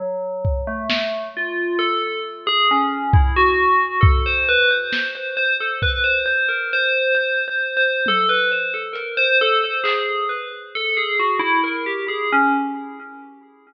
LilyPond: <<
  \new Staff \with { instrumentName = "Tubular Bells" } { \time 7/8 \tempo 4 = 67 fis8. a8. f'8 a'8 r16 gis'16 cis'8 | e'16 fis'8. a'16 c''16 b'16 c''8 c''16 c''16 a'16 b'16 c''16 | c''16 ais'16 c''8 \tuplet 3/2 { c''8 c''8 c''8 } a'16 b'16 c''16 a'16 ais'16 c''16 | a'16 c''16 gis'8 b'16 r16 a'16 gis'16 fis'16 e'16 ais'16 g'16 gis'16 cis'16 | }
  \new DrumStaff \with { instrumentName = "Drums" } \drummode { \time 7/8 r8 bd8 sn4 r4. | bd4 bd4 sn4 bd8 | r4 r4 tommh4 hh8 | r8 hc8 r4 r4. | }
>>